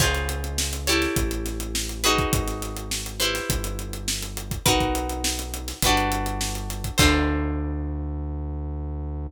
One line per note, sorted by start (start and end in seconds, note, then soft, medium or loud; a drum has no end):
0.00 1.07 C#2 medium
0.00 0.83 F4 medium
0.00 0.83 G#4 loud
0.00 0.83 C5 loud
0.00 0.83 C#5 medium
0.00 kick loud
0.00 crash medium
0.15 snare soft
0.15 closed hi-hat medium
0.29 closed hi-hat medium
0.44 closed hi-hat medium
0.58 snare loud
0.73 snare soft
0.73 closed hi-hat medium
0.87 1.98 E4 medium
0.87 1.98 G4 loud
0.87 1.98 A4 medium
0.87 1.98 C#5 loud
0.87 snare soft
0.87 closed hi-hat medium
1.02 snare soft
1.02 closed hi-hat medium
1.16 2.24 A1 medium
1.16 kick medium
1.16 closed hi-hat medium
1.31 closed hi-hat medium
1.46 snare soft
1.46 closed hi-hat medium
1.60 closed hi-hat medium
1.75 snare loud
1.89 closed hi-hat medium
2.04 3.14 D#4 loud
2.04 3.14 F#4 loud
2.04 3.14 G#4 loud
2.04 3.14 B4 loud
2.04 snare soft
2.04 closed hi-hat medium
2.18 kick medium
2.18 closed hi-hat medium
2.33 3.40 G#1 medium
2.33 kick loud
2.33 closed hi-hat loud
2.48 snare soft
2.48 closed hi-hat medium
2.62 snare soft
2.62 closed hi-hat medium
2.77 closed hi-hat medium
2.91 snare medium
3.06 closed hi-hat medium
3.20 4.63 E4 loud
3.20 4.63 G4 medium
3.20 4.63 B4 medium
3.20 4.63 C5 medium
3.20 closed hi-hat medium
3.35 snare medium
3.35 closed hi-hat medium
3.50 4.57 G1 medium
3.50 kick medium
3.50 closed hi-hat loud
3.64 closed hi-hat medium
3.79 closed hi-hat medium
3.93 closed hi-hat medium
4.08 snare loud
4.23 closed hi-hat medium
4.37 closed hi-hat medium
4.51 kick medium
4.51 closed hi-hat medium
4.66 5.73 B1 medium
4.66 5.80 D#4 loud
4.66 5.80 F#4 loud
4.66 5.80 A#4 loud
4.66 5.80 B4 loud
4.66 kick loud
4.66 closed hi-hat loud
4.80 kick medium
4.80 closed hi-hat medium
4.95 closed hi-hat medium
5.09 closed hi-hat medium
5.24 snare loud
5.39 closed hi-hat medium
5.54 closed hi-hat medium
5.68 snare medium
5.68 closed hi-hat medium
5.82 6.90 G1 medium
5.82 6.98 F#4 loud
5.82 6.98 G4 loud
5.82 6.98 B4 medium
5.82 kick medium
5.82 closed hi-hat loud
5.86 6.98 D4 loud
5.97 closed hi-hat medium
6.12 closed hi-hat medium
6.26 closed hi-hat medium
6.41 snare medium
6.55 closed hi-hat medium
6.70 snare soft
6.70 closed hi-hat medium
6.84 kick medium
6.84 closed hi-hat medium
6.98 9.27 D2 loud
6.98 9.26 D4 medium
6.98 9.26 F4 medium
6.98 9.26 A4 medium
6.98 9.26 C5 loud
6.98 kick loud
6.98 crash loud